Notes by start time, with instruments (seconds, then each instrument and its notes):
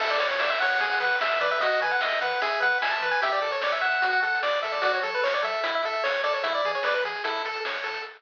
0.00 synth bass 1 A1, lead 1 (square) A4 E5, kick, crash
0.10 lead 1 (square) D5, closed hi-hat
0.20 synth bass 1 A2, lead 1 (square) C#5, closed hi-hat
0.30 lead 1 (square) C#5, closed hi-hat
0.39 synth bass 1 A1, lead 1 (square) D5 E5, snare
0.50 lead 1 (square) E5, closed hi-hat
0.60 synth bass 1 A2, lead 1 (square) C#5 F#5, closed hi-hat
0.71 closed hi-hat
0.80 synth bass 1 E2, lead 1 (square) G#4, kick, closed hi-hat
0.90 lead 1 (square) F#5, closed hi-hat
1.00 synth bass 1 E3, lead 1 (square) B4 F#5, closed hi-hat
1.12 closed hi-hat
1.21 synth bass 1 E2, lead 1 (square) E5, snare
1.31 closed hi-hat
1.40 synth bass 1 E3, lead 1 (square) B4 D5, closed hi-hat
1.51 lead 1 (square) E5, closed hi-hat
1.59 synth bass 1 D#2, lead 1 (square) F#4 D#5, kick, closed hi-hat
1.72 closed hi-hat
1.81 synth bass 1 D#3, lead 1 (square) B4 G#5, closed hi-hat
1.90 lead 1 (square) F#5, closed hi-hat
2.01 synth bass 1 D#2, lead 1 (square) D#5 E5, snare
2.12 closed hi-hat
2.21 synth bass 1 D#3, lead 1 (square) B4 F#5, closed hi-hat
2.31 closed hi-hat
2.42 synth bass 1 E2, lead 1 (square) G#4 E5, kick, closed hi-hat
2.52 closed hi-hat
2.60 synth bass 1 E3, lead 1 (square) B4 F#5, closed hi-hat
2.71 closed hi-hat
2.81 synth bass 1 E2, lead 1 (square) E5 G#5, snare
2.91 lead 1 (square) A5, closed hi-hat
3.01 synth bass 1 E3, lead 1 (square) B4, closed hi-hat
3.11 lead 1 (square) G#5, closed hi-hat
3.22 synth bass 1 A1, lead 1 (square) G4 E5, kick, closed hi-hat
3.32 lead 1 (square) D5, closed hi-hat
3.42 synth bass 1 A2, lead 1 (square) A4, closed hi-hat
3.51 lead 1 (square) C#5, closed hi-hat
3.61 synth bass 1 A1, lead 1 (square) C#5 D5, snare
3.72 lead 1 (square) E5, closed hi-hat
3.81 synth bass 1 A2, lead 1 (square) E5 F#5, closed hi-hat
3.92 closed hi-hat
4.02 synth bass 1 D2, lead 1 (square) F#4, kick, closed hi-hat
4.13 lead 1 (square) F#5, closed hi-hat
4.22 synth bass 1 D3, lead 1 (square) A4 F#5, closed hi-hat
4.35 closed hi-hat
4.43 synth bass 1 D2, lead 1 (square) D5, snare
4.53 closed hi-hat
4.63 synth bass 1 D3, lead 1 (square) A4 E5, closed hi-hat
4.72 lead 1 (square) D5, open hi-hat
4.82 synth bass 1 F#2, lead 1 (square) F#4 D5, kick, closed hi-hat
4.94 lead 1 (square) C#5, closed hi-hat
5.02 synth bass 1 F#3, lead 1 (square) A4, closed hi-hat
5.14 lead 1 (square) B4, closed hi-hat
5.23 synth bass 1 F#2, lead 1 (square) C#5, snare
5.33 lead 1 (square) D5, closed hi-hat
5.43 synth bass 1 F#3, lead 1 (square) A4 E5, closed hi-hat
5.53 closed hi-hat
5.64 synth bass 1 A1, lead 1 (square) E4, kick, closed hi-hat
5.74 lead 1 (square) E5, closed hi-hat
5.83 synth bass 1 A2, lead 1 (square) A4 E5, closed hi-hat
5.93 closed hi-hat
6.04 synth bass 1 A1, lead 1 (square) C#5, snare
6.14 closed hi-hat
6.23 synth bass 1 A2, lead 1 (square) A4 D5, closed hi-hat
6.34 lead 1 (square) C#5, closed hi-hat
6.43 synth bass 1 E2, lead 1 (square) E4 E5, kick, closed hi-hat
6.55 lead 1 (square) D5, closed hi-hat
6.64 synth bass 1 E3, lead 1 (square) G#4, closed hi-hat
6.74 lead 1 (square) C#5, closed hi-hat
6.83 synth bass 1 E2, lead 1 (square) B4 D5, snare
6.95 lead 1 (square) B4, closed hi-hat
7.04 synth bass 1 E3, lead 1 (square) G#4, closed hi-hat
7.15 closed hi-hat
7.24 synth bass 1 A1, lead 1 (square) E4 A4, kick, closed hi-hat
7.36 closed hi-hat
7.45 synth bass 1 A2, lead 1 (square) A4, closed hi-hat
7.54 closed hi-hat
7.65 synth bass 1 A1, lead 1 (square) C#5, snare
7.75 closed hi-hat
7.84 synth bass 1 A2, lead 1 (square) A4, closed hi-hat
7.94 closed hi-hat